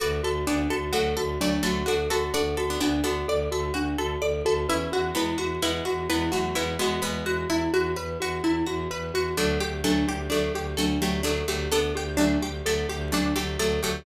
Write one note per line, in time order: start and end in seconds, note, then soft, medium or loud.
0.00 0.20 D2 medium
0.00 0.20 F#4 medium
0.00 0.22 A4 medium
0.00 0.40 B4 medium
0.00 0.40 D5 medium
0.23 0.44 D2 medium
0.23 0.45 F#4 medium
0.23 0.45 A4 medium
0.47 0.67 D2 medium
0.47 0.79 B3 medium
0.47 0.68 D4 medium
0.47 0.79 D4 medium
0.47 0.68 D5 medium
0.70 0.91 D2 medium
0.70 0.92 F#4 medium
0.70 0.91 A4 medium
0.93 1.14 D2 medium
0.93 1.32 F#3 medium
0.93 1.32 A3 medium
0.93 1.14 F#4 medium
0.93 1.15 A4 medium
1.17 1.38 D2 medium
1.17 1.39 F#4 medium
1.17 1.38 A4 medium
1.39 1.59 D2 medium
1.39 1.61 F#3 medium
1.39 1.61 A3 medium
1.39 1.62 D4 medium
1.39 1.62 D5 medium
1.63 1.84 D2 medium
1.63 1.83 F#3 medium
1.63 1.83 A3 medium
1.63 1.86 F#4 medium
1.63 1.84 A4 medium
1.86 2.08 D2 medium
1.86 2.09 D4 medium
1.86 2.07 F#4 medium
1.86 2.09 F#4 medium
1.86 2.09 A4 medium
2.10 2.30 D2 medium
2.10 2.30 F#4 medium
2.10 2.33 F#4 medium
2.10 2.30 A4 loud
2.10 2.32 A4 medium
2.34 2.55 D2 medium
2.34 2.67 D4 medium
2.34 2.67 F#4 loud
2.34 2.56 A4 medium
2.34 2.55 D5 medium
2.57 2.77 D2 medium
2.57 2.79 F#4 medium
2.57 2.78 A4 medium
2.70 2.80 B3 medium
2.70 2.80 D4 medium
2.80 3.01 D2 medium
2.80 3.02 B3 medium
2.80 3.02 D4 medium
2.80 3.03 D4 medium
2.80 3.01 F#4 medium
3.04 3.24 D2 medium
3.04 3.80 B3 medium
3.04 3.80 D4 medium
3.04 3.26 F#4 medium
3.04 3.25 A4 medium
3.28 3.48 D2 medium
3.28 3.50 A4 medium
3.28 3.50 D5 medium
3.51 3.71 D2 medium
3.51 3.73 F#4 medium
3.51 3.73 A4 medium
3.74 3.95 D2 medium
3.74 3.97 D4 medium
3.74 3.95 F#4 medium
3.97 4.17 D2 medium
3.97 4.20 F#4 medium
3.97 4.19 A4 medium
4.22 4.42 D2 medium
4.22 4.43 A4 medium
4.22 4.43 D5 medium
4.45 4.66 D2 medium
4.45 4.67 F#4 medium
4.45 4.67 A4 medium
4.68 4.88 E2 medium
4.68 5.12 C#4 medium
4.68 4.91 E4 medium
4.68 5.12 E4 medium
4.68 4.90 B4 medium
4.92 5.12 E2 medium
4.92 5.14 F#4 medium
5.15 5.35 E2 medium
5.15 5.46 G#3 medium
5.15 5.46 B3 medium
5.15 5.37 E4 medium
5.15 5.38 B4 medium
5.38 5.58 E2 medium
5.38 5.59 F#4 medium
5.38 5.61 F#4 medium
5.61 5.81 E2 medium
5.61 6.04 G#3 medium
5.61 6.04 B3 medium
5.61 5.84 E4 medium
5.61 5.84 B4 medium
5.85 6.07 E2 medium
5.85 6.06 F#4 medium
5.85 6.08 F#4 medium
6.09 6.29 E2 medium
6.09 6.32 G#3 medium
6.09 6.32 B3 medium
6.09 6.31 E4 medium
6.09 6.31 B4 medium
6.32 6.53 E2 medium
6.32 6.55 F#3 medium
6.32 6.55 A3 medium
6.32 6.53 F#4 medium
6.32 6.54 F#4 medium
6.55 6.77 E2 medium
6.55 6.75 G#3 medium
6.55 6.75 B3 medium
6.55 6.76 E4 medium
6.55 6.78 B4 medium
6.79 6.99 E2 medium
6.79 7.01 G#3 medium
6.79 7.01 B3 loud
6.79 7.01 F#4 medium
6.79 7.02 F#4 medium
7.02 7.23 E2 medium
7.02 7.71 G#3 medium
7.02 7.71 B3 loud
7.02 7.23 B4 medium
7.02 7.25 B4 medium
7.26 7.46 E2 medium
7.26 7.47 F#4 medium
7.26 7.48 F#4 medium
7.49 7.68 E2 medium
7.49 7.71 E4 medium
7.49 7.72 E4 medium
7.73 7.94 E2 medium
7.73 7.95 F#4 medium
7.96 8.17 E2 medium
7.96 8.17 B4 medium
7.96 8.18 B4 medium
8.20 8.40 E2 medium
8.20 8.42 F#4 medium
8.20 8.43 F#4 medium
8.43 8.63 E2 medium
8.43 8.65 E4 medium
8.66 8.87 E2 medium
8.66 8.88 F#4 medium
8.66 8.89 F#4 medium
8.91 9.11 E2 medium
8.91 9.12 B4 medium
9.14 9.34 E2 medium
9.14 9.36 F#4 medium
9.37 9.57 D2 loud
9.37 9.81 F#3 medium
9.37 9.81 A3 loud
9.37 9.58 D4 medium
9.37 9.59 A4 medium
9.60 9.82 D2 medium
9.60 9.81 G4 medium
9.60 9.83 G4 medium
9.84 10.04 D2 medium
9.84 10.18 F#3 medium
9.84 10.18 A3 medium
9.84 10.06 D4 loud
9.84 10.05 A4 medium
10.08 10.28 D2 medium
10.08 10.29 G4 medium
10.08 10.30 G4 medium
10.30 10.50 D2 medium
10.30 10.71 F#3 medium
10.30 10.71 A3 medium
10.30 10.51 D4 medium
10.30 10.53 A4 loud
10.54 10.74 D2 medium
10.54 10.76 G4 medium
10.77 10.98 D2 medium
10.77 10.99 F#3 medium
10.77 10.99 A3 medium
10.77 11.00 D4 medium
10.77 10.98 A4 medium
11.02 11.22 D2 medium
11.02 11.21 F#3 medium
11.02 11.21 A3 medium
11.02 11.23 G4 medium
11.02 11.24 G4 medium
11.23 11.43 D2 medium
11.23 11.43 F#3 medium
11.23 11.43 A3 medium
11.23 11.44 D4 medium
11.23 11.47 A4 medium
11.48 11.68 D2 medium
11.48 11.68 F#3 medium
11.48 11.68 A3 medium
11.48 11.70 G4 medium
11.71 11.93 D2 medium
11.71 12.15 B3 loud
11.71 12.15 D4 loud
11.71 11.93 A4 medium
11.71 11.93 A4 loud
11.95 12.16 D2 medium
11.95 12.17 G4 medium
11.95 12.18 G4 medium
12.17 12.37 D2 medium
12.17 12.49 F#3 medium
12.17 12.49 A3 medium
12.17 12.38 D4 medium
12.17 12.40 D4 medium
12.41 12.61 D2 medium
12.41 12.64 G4 medium
12.41 12.63 G4 medium
12.65 12.85 D2 medium
12.65 13.08 F#3 medium
12.65 13.08 A3 medium
12.65 12.87 A4 medium
12.89 13.10 D2 medium
12.89 13.11 G4 medium
13.12 13.32 D2 medium
13.12 13.34 F#3 medium
13.12 13.34 A3 medium
13.12 13.34 D4 medium
13.12 13.35 D4 medium
13.36 13.56 D2 medium
13.36 13.57 F#3 medium
13.36 13.57 A3 medium
13.36 13.57 G4 medium
13.36 13.58 G4 medium
13.59 13.79 D2 medium
13.59 13.81 F#3 medium
13.59 13.81 A3 medium
13.59 13.80 A4 medium
13.59 13.81 A4 loud
13.83 14.03 D2 medium
13.83 14.03 F#3 medium
13.83 14.03 A3 loud
13.83 14.04 G4 medium